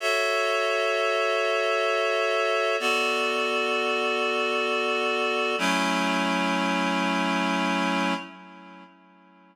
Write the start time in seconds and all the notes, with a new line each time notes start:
0.00 F#4 A4 C#5 E5
2.80 B3 F#4 A4 D5
5.58 F#3 A3 C#4 E4